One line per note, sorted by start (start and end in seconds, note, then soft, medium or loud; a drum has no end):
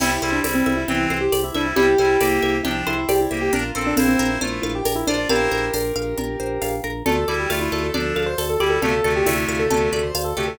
0.00 0.19 C2 loud
0.00 0.10 G3 loud
0.00 0.10 E4 loud
0.00 0.30 E4 medium
0.00 0.88 G4 loud
0.00 crash loud
0.00 cowbell medium
0.00 low conga loud
0.22 0.41 C2 loud
0.22 0.40 G3 medium
0.22 0.40 E4 loud
0.22 1.10 C5 medium
0.22 high conga medium
0.32 0.43 D4 medium
0.43 0.63 C2 medium
0.43 0.83 G3 medium
0.43 0.54 C4 medium
0.43 0.83 E4 medium
0.43 1.32 D5 medium
0.43 tambourine medium
0.43 cowbell medium
0.43 high conga medium
0.54 0.73 C4 medium
0.66 0.85 C2 loud
0.66 1.54 E5 medium
0.66 high conga medium
0.77 1.05 E4 medium
0.88 1.07 C2 loud
0.88 1.17 E3 medium
0.88 1.17 C4 loud
0.88 1.76 G4 medium
0.88 cowbell medium
0.88 low conga medium
1.10 1.29 C2 medium
1.10 1.22 E4 medium
1.10 1.98 C5 medium
1.10 high conga medium
1.21 1.40 G4 medium
1.32 1.51 C2 loud
1.32 2.20 D5 medium
1.32 tambourine medium
1.32 cowbell medium
1.32 high conga medium
1.44 1.54 E4 medium
1.54 1.73 C2 medium
1.54 1.74 G3 medium
1.54 1.66 D4 medium
1.54 1.74 E4 medium
1.54 2.42 E5 medium
1.54 high conga medium
1.66 1.76 E4 medium
1.76 1.95 C2 loud
1.76 1.86 G3 loud
1.76 1.86 E4 loud
1.76 2.54 E4 medium
1.76 2.54 G4 medium
1.76 2.64 G4 medium
1.76 cowbell medium
1.76 low conga loud
1.98 2.17 C2 medium
1.98 2.17 G3 medium
1.98 2.17 E4 medium
1.98 2.86 C5 medium
1.98 high conga medium
2.20 2.39 C2 loud
2.20 2.57 A#3 medium
2.20 2.57 G4 loud
2.20 3.08 D5 medium
2.20 tambourine medium
2.20 cowbell medium
2.20 high conga medium
2.42 2.61 C2 loud
2.42 3.30 E5 medium
2.42 high conga medium
2.63 2.83 C2 medium
2.63 2.94 F3 medium
2.63 2.94 D4 medium
2.63 2.74 E4 medium
2.63 3.48 G4 loud
2.63 cowbell medium
2.63 low conga medium
2.87 3.06 C2 medium
2.87 2.97 E4 medium
2.87 3.50 C5 loud
2.87 high conga medium
2.98 3.08 E4 medium
3.09 3.28 C2 medium
3.09 3.19 G4 medium
3.09 3.51 D5 medium
3.09 tambourine medium
3.09 cowbell medium
3.09 high conga medium
3.21 3.32 E4 medium
3.31 3.50 C2 loud
3.31 3.53 A#3 medium
3.31 3.53 G4 medium
3.31 3.52 E5 medium
3.31 high conga medium
3.41 3.52 G4 medium
3.53 3.72 A#1 loud
3.53 3.63 D4 loud
3.53 3.81 F4 medium
3.53 4.19 A#4 loud
3.53 3.63 A#4 loud
3.53 cowbell medium
3.53 low conga medium
3.75 3.94 A#1 loud
3.75 3.94 C4 medium
3.75 3.94 A4 medium
3.75 4.41 C5 medium
3.87 3.97 D4 medium
3.96 4.16 A#1 loud
3.96 4.07 C4 medium
3.96 4.38 E4 medium
3.96 4.38 C5 loud
3.96 4.63 F5 medium
3.96 tambourine medium
3.96 cowbell medium
3.96 high conga loud
4.08 4.30 C4 medium
4.19 4.38 A#1 loud
4.19 4.85 A#4 loud
4.19 high conga medium
4.31 4.59 E4 medium
4.41 4.60 A#1 medium
4.41 4.72 A3 medium
4.41 4.72 F4 medium
4.41 5.07 C5 medium
4.41 cowbell medium
4.41 low conga medium
4.62 4.82 A#1 loud
4.62 4.73 E4 medium
4.62 5.29 F5 medium
4.62 high conga medium
4.75 4.95 G4 medium
4.85 5.04 A#1 medium
4.85 5.51 A#4 medium
4.85 tambourine medium
4.85 cowbell medium
4.85 high conga medium
4.95 5.06 E4 medium
5.07 5.26 A#1 medium
5.07 5.17 D4 medium
5.07 5.28 F4 medium
5.07 5.73 C5 medium
5.07 5.28 D5 medium
5.07 high conga medium
5.17 5.28 D4 medium
5.29 5.48 A#1 loud
5.29 5.65 E4 loud
5.29 6.75 G4 medium
5.29 6.75 A#4 medium
5.29 5.65 C5 loud
5.29 5.95 F5 loud
5.29 cowbell loud
5.29 low conga medium
5.51 5.70 A#1 loud
5.51 6.17 A#4 medium
5.51 high conga medium
5.73 5.92 A#1 loud
5.73 6.39 C5 medium
5.73 tambourine medium
5.73 cowbell medium
5.73 high conga medium
5.96 6.14 A#1 loud
5.96 6.61 F5 medium
5.96 high conga medium
6.18 6.36 A#1 loud
6.18 6.83 A#4 medium
6.18 cowbell medium
6.18 low conga medium
6.40 6.59 A#1 medium
6.40 7.03 C5 medium
6.62 6.81 A#1 medium
6.62 7.04 F5 medium
6.62 tambourine medium
6.62 cowbell medium
6.62 high conga medium
6.84 7.03 A#1 loud
6.84 7.05 A#4 medium
6.84 high conga medium
7.06 7.25 D2 loud
7.06 7.16 A3 medium
7.06 7.16 F4 medium
7.06 7.34 A4 medium
7.06 7.72 A4 loud
7.06 cowbell medium
7.06 low conga loud
7.28 7.47 D2 loud
7.28 7.49 G3 medium
7.28 7.49 E4 medium
7.28 7.94 D5 medium
7.28 high conga medium
7.39 7.50 G4 medium
7.50 7.69 D2 loud
7.50 7.86 A3 medium
7.50 7.61 E4 medium
7.50 7.86 F4 medium
7.50 8.16 F5 medium
7.50 tambourine medium
7.50 cowbell medium
7.50 high conga medium
7.61 7.81 E4 medium
7.72 7.91 D2 loud
7.72 8.38 A4 medium
7.72 high conga medium
7.83 8.14 A4 medium
7.94 8.13 D2 loud
7.94 8.25 F3 medium
7.94 8.25 D4 medium
7.94 8.60 D5 medium
7.94 cowbell medium
7.94 low conga medium
8.16 8.35 D2 medium
8.16 8.26 A4 medium
8.16 8.82 F5 medium
8.16 high conga medium
8.26 8.44 C5 medium
8.38 8.57 D2 loud
8.38 9.04 A4 medium
8.38 tambourine medium
8.38 cowbell medium
8.38 high conga medium
8.49 8.60 A4 medium
8.60 8.79 D2 loud
8.60 8.79 G3 medium
8.60 8.79 E4 medium
8.60 8.70 G4 medium
8.60 9.26 D5 medium
8.60 high conga medium
8.70 8.81 A4 medium
8.82 9.01 D2 medium
8.82 8.93 C3 loud
8.82 8.93 A3 loud
8.82 9.13 A4 medium
8.82 9.48 F5 medium
8.82 cowbell medium
8.82 low conga medium
9.04 9.23 D2 loud
9.04 9.26 C3 medium
9.04 9.26 A3 medium
9.04 9.70 A4 medium
9.04 high conga medium
9.16 9.26 G4 medium
9.26 9.45 D2 loud
9.26 9.62 C3 loud
9.26 9.62 A3 loud
9.26 9.36 E4 medium
9.26 9.92 D5 medium
9.26 tambourine medium
9.26 cowbell medium
9.26 high conga medium
9.37 9.58 E4 medium
9.48 9.67 D2 loud
9.48 10.14 F5 medium
9.48 high conga medium
9.59 9.88 A4 medium
9.70 9.89 D2 loud
9.70 10.01 C3 medium
9.70 10.01 A3 medium
9.70 10.36 A4 loud
9.70 cowbell medium
9.70 low conga medium
9.93 10.11 D2 loud
9.93 10.03 A4 medium
9.93 10.56 D5 medium
9.93 high conga medium
10.03 10.23 C5 medium
10.15 10.33 D2 loud
10.15 10.57 F5 medium
10.15 tambourine medium
10.15 cowbell medium
10.15 high conga medium
10.24 10.35 A4 medium
10.36 10.56 D2 medium
10.36 10.58 C3 medium
10.36 10.58 A3 medium
10.36 10.47 G4 medium
10.36 10.58 A4 medium
10.48 10.58 A4 medium